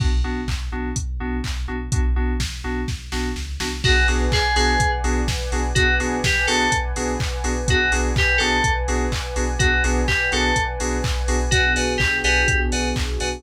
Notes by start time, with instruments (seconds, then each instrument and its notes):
0.00 synth bass 2 B1, electric piano 2 B3 D4 F#4, kick, crash
0.24 synth bass 2 B1, electric piano 2 B3 D4 F#4
0.48 synth bass 2 B1, kick, clap
0.72 synth bass 2 B1, electric piano 2 B3 D4 F#4
0.96 synth bass 2 B1, kick, closed hi-hat
1.20 synth bass 2 B1, electric piano 2 B3 D4 F#4
1.44 synth bass 2 B1, kick, clap
1.68 synth bass 2 B1, electric piano 2 B3 D4 F#4
1.92 synth bass 2 B1, electric piano 2 B3 D4 F#4, kick, closed hi-hat
2.16 synth bass 2 B1, electric piano 2 B3 D4 F#4
2.40 synth bass 2 B1, kick, snare
2.64 synth bass 2 B1, electric piano 2 B3 D4 F#4
2.88 synth bass 2 B1, kick, snare
3.12 synth bass 2 B1, electric piano 2 B3 D4 F#4, snare
3.36 synth bass 2 C#2, snare
3.60 synth bass 2 C2, electric piano 2 B3 D4 F#4, snare
3.83 synth bass 2 B1, electric piano 2 B3 D4 F#4 G#4, pad 2 (warm) B4 D5 F#5 G#5, kick, crash
4.08 synth bass 2 B1, electric piano 2 B3 D4 F#4 G#4, open hi-hat
4.32 synth bass 2 B1, electric piano 2 G#4, kick, clap
4.56 synth bass 2 B1, electric piano 2 B3 D4 F#4 G#4, open hi-hat
4.80 synth bass 2 B1, kick, closed hi-hat
5.04 synth bass 2 B1, electric piano 2 B3 D4 F#4 G#4, open hi-hat
5.28 synth bass 2 B1, kick, snare
5.52 synth bass 2 B1, electric piano 2 B3 D4 F#4 G#4, open hi-hat
5.75 synth bass 2 B1, electric piano 2 B3 D4 F#4 G#4, pad 2 (warm) B4 D5 F#5 G#5, kick, closed hi-hat
6.00 synth bass 2 B1, electric piano 2 B3 D4 F#4 G#4, open hi-hat
6.24 synth bass 2 B1, electric piano 2 G4, kick, snare
6.47 synth bass 2 B1, electric piano 2 B3 D4 F#4 G#4 A4, open hi-hat
6.72 synth bass 2 B1, kick, closed hi-hat
6.96 synth bass 2 B1, electric piano 2 B3 D4 F#4 G#4, open hi-hat
7.20 synth bass 2 B1, kick, clap
7.44 synth bass 2 B1, electric piano 2 B3 D4 F#4 G#4, open hi-hat
7.68 synth bass 2 B1, electric piano 2 B3 D4 F#4 G#4, pad 2 (warm) B4 D5 F#5 G#5, kick, closed hi-hat
7.92 synth bass 2 B1, electric piano 2 B3 D4 F#4 G#4, open hi-hat
8.16 synth bass 2 B1, electric piano 2 G4, kick, clap
8.38 synth bass 2 B1, electric piano 2 B3 D4 F#4 G#4 A4, open hi-hat
8.64 synth bass 2 B1, kick, closed hi-hat
8.88 synth bass 2 B1, electric piano 2 B3 D4 F#4 G#4, open hi-hat
9.12 synth bass 2 B1, kick, clap
9.36 synth bass 2 B1, electric piano 2 B3 D4 F#4 G#4, open hi-hat
9.59 synth bass 2 B1, electric piano 2 B3 D4 F#4 G#4, pad 2 (warm) B4 D5 F#5 G#5, kick, closed hi-hat
9.84 synth bass 2 B1, electric piano 2 B3 D4 F#4 G#4, open hi-hat
10.08 synth bass 2 B1, electric piano 2 G4, kick, clap
10.32 synth bass 2 B1, electric piano 2 B3 D4 F#4 G#4 A4, open hi-hat
10.56 synth bass 2 B1, kick, closed hi-hat
10.80 synth bass 2 B1, electric piano 2 B3 D4 F#4 G#4, open hi-hat
11.04 synth bass 2 B1, kick, clap
11.28 synth bass 2 B1, electric piano 2 B3 D4 F#4 G#4, open hi-hat
11.51 synth bass 2 B1, pad 2 (warm) B3 D4 F#4 G#4, electric piano 2 F#4 B4 D5 F#5 G#5, kick, closed hi-hat
11.76 synth bass 2 B1, electric piano 2 B4 D5 F#5 G#5, open hi-hat
11.98 synth bass 2 B1, electric piano 2 G4, kick, clap
12.24 synth bass 2 B1, electric piano 2 G4 B4 D5 F#5 G#5, open hi-hat
12.48 synth bass 2 B1, kick, closed hi-hat
12.72 synth bass 2 B1, electric piano 2 B4 D5 F#5 G#5, open hi-hat
12.96 synth bass 2 B1, kick, clap
13.20 synth bass 2 B1, electric piano 2 B4 D5 F#5 G#5, open hi-hat